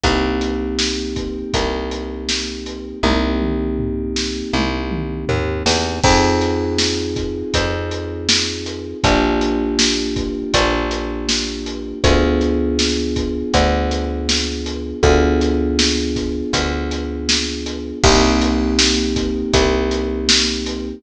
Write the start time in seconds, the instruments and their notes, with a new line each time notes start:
0.03 electric bass (finger) C2, electric piano 2 A#3 C4 D#4 G4, kick, closed hi-hat
0.41 closed hi-hat
0.79 snare
1.16 kick, closed hi-hat
1.53 electric bass (finger) C2, kick, closed hi-hat
1.91 closed hi-hat
2.29 snare
2.66 closed hi-hat
3.03 electric bass (finger) C2, electric piano 2 A#3 C4 D#4 G4, kick, high tom
3.41 mid tom
3.79 floor tom
4.16 snare
4.53 electric bass (finger) C2, high tom
4.91 mid tom
5.28 electric bass (finger) D#2, floor tom
5.66 electric bass (finger) E2, snare
6.03 electric bass (finger) F2, electric piano 2 C4 D#4 F4 G#4, kick, crash
6.41 closed hi-hat
6.78 snare
7.16 kick, closed hi-hat
7.54 electric bass (finger) F2, kick, closed hi-hat
7.91 closed hi-hat
8.29 snare
8.66 closed hi-hat
9.04 electric bass (finger) A#1, electric piano 2 A#3 D4 F4 G4, kick, closed hi-hat
9.41 closed hi-hat
9.79 snare
10.16 kick, closed hi-hat
10.54 electric bass (finger) A#1, kick, closed hi-hat
10.91 closed hi-hat
11.29 snare
11.66 closed hi-hat
12.04 electric bass (finger) D2, electric piano 2 B3 D4 F4 G#4, kick, closed hi-hat
12.41 closed hi-hat
12.79 snare
13.16 kick, closed hi-hat
13.54 electric bass (finger) D2, kick, closed hi-hat
13.91 closed hi-hat
14.29 snare
14.66 closed hi-hat
15.03 electric bass (finger) D2, electric piano 2 B3 D4 F4 G#4, kick, closed hi-hat
15.41 closed hi-hat
15.79 snare
16.16 kick, snare, closed hi-hat
16.53 electric bass (finger) D2, kick, closed hi-hat
16.91 closed hi-hat
17.29 snare
17.66 closed hi-hat
18.03 electric bass (finger) C2, electric piano 2 A#3 C4 D#4 G4, kick, crash
18.41 closed hi-hat
18.79 snare
19.16 kick, closed hi-hat
19.53 electric bass (finger) C2, kick, closed hi-hat
19.91 closed hi-hat
20.29 snare
20.66 closed hi-hat